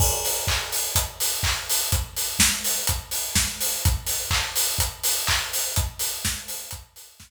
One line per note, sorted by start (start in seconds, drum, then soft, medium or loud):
0.00 kick loud
0.00 crash loud
0.25 open hi-hat medium
0.47 kick medium
0.47 clap loud
0.72 open hi-hat medium
0.96 kick medium
0.96 closed hi-hat loud
1.20 open hi-hat medium
1.43 kick medium
1.43 clap loud
1.70 open hi-hat medium
1.92 kick loud
1.92 closed hi-hat loud
2.17 open hi-hat medium
2.39 kick medium
2.39 snare loud
2.64 open hi-hat medium
2.87 kick medium
2.87 closed hi-hat loud
3.11 open hi-hat medium
3.35 kick medium
3.35 snare loud
3.60 open hi-hat medium
3.85 kick loud
3.85 closed hi-hat loud
4.07 open hi-hat medium
4.31 kick medium
4.31 clap loud
4.56 open hi-hat medium
4.79 kick medium
4.79 closed hi-hat loud
5.04 open hi-hat medium
5.27 kick medium
5.27 clap loud
5.53 open hi-hat medium
5.76 kick loud
5.76 closed hi-hat loud
5.99 open hi-hat medium
6.25 kick medium
6.25 snare loud
6.48 open hi-hat medium
6.71 kick medium
6.71 closed hi-hat loud
6.96 open hi-hat medium
7.20 kick medium
7.20 snare loud